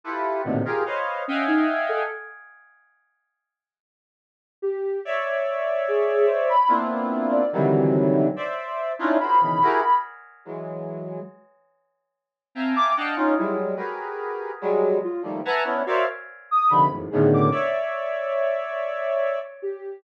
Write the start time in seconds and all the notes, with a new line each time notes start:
0.04 E4 F4 G4 A4 B4
0.44 A2 A#2 B2 C3 D3 D#3
0.65 F4 G4 G#4 A#4
0.86 B4 C5 C#5 D#5 F5
1.28 C#4 D#5 E5 F5 F#5 G5 G#5
1.47 D#4
1.89 A4
4.62 G4
5.05 C#5 D5 E5
5.88 G#4
6.26 C5
6.49 B5
6.68 A#3 B3 C4 D4 E4 F4
7.31 D5
7.53 C3 D3 D#3 E3 F#3 G3
8.36 C5 D5 E5
8.99 C#4 D4 D#4 E4 F4
9.20 F4 F#4 G#4 A#4 C5 B5
9.41 B2 C#3 D#3 E3
9.62 E4 F#4 G4 G#4 A#4
10.45 E3 F#3 G#3
12.55 C4 E5 F5 G5 G#5 A5 A#5
12.75 D6
12.97 D4 D#5 F5 F#5 G5 A5
13.16 C#4 D#4 F4
13.36 F#3 G3 G#3 E4
13.76 F#4 G4 G#4 A#4 B4
14.61 F#3 G3 G#3
15.04 F4
15.23 D#3 F3 G3 A3 A#3
15.45 B4 E5 F#5 G#5 A5 A#5
15.64 B3 C#4 D4 E4
15.86 F#4 A#4 C5 C#5 D5 E5 F5
16.51 D#6
16.70 C3 D3 D#3 F3 B5
16.90 E2 F#2 G#2 A2
17.10 A2 B2 C#3 D3 D#3 G#4
17.34 D6
17.52 C#5 D5 E5
19.62 G4